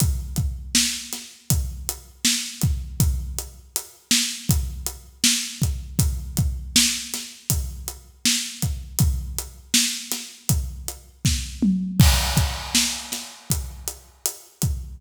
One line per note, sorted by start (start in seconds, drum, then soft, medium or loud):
0.00 kick medium
0.00 closed hi-hat medium
0.36 kick medium
0.36 closed hi-hat medium
0.75 snare loud
1.13 snare soft
1.13 closed hi-hat medium
1.50 kick medium
1.50 closed hi-hat medium
1.89 closed hi-hat medium
2.25 snare medium
2.62 kick medium
2.62 closed hi-hat medium
3.00 kick medium
3.00 closed hi-hat medium
3.39 closed hi-hat medium
3.76 closed hi-hat medium
4.11 snare medium
4.49 kick medium
4.49 closed hi-hat medium
4.86 closed hi-hat medium
5.24 snare loud
5.62 kick medium
5.62 closed hi-hat medium
5.99 kick medium
5.99 closed hi-hat medium
6.37 kick medium
6.37 closed hi-hat medium
6.76 snare loud
7.14 snare medium
7.14 closed hi-hat medium
7.50 kick medium
7.50 closed hi-hat loud
7.88 closed hi-hat medium
8.25 snare medium
8.62 kick medium
8.62 closed hi-hat medium
8.99 kick medium
8.99 closed hi-hat medium
9.38 closed hi-hat medium
9.74 snare loud
10.12 snare medium
10.12 closed hi-hat medium
10.49 kick medium
10.49 closed hi-hat medium
10.88 closed hi-hat medium
11.25 kick medium
11.25 snare medium
11.62 mid tom medium
12.00 kick loud
12.00 crash medium
12.37 kick medium
12.37 closed hi-hat medium
12.75 snare medium
13.12 snare medium
13.12 closed hi-hat medium
13.50 kick medium
13.50 closed hi-hat medium
13.88 closed hi-hat medium
14.26 closed hi-hat medium
14.62 kick medium
14.62 closed hi-hat medium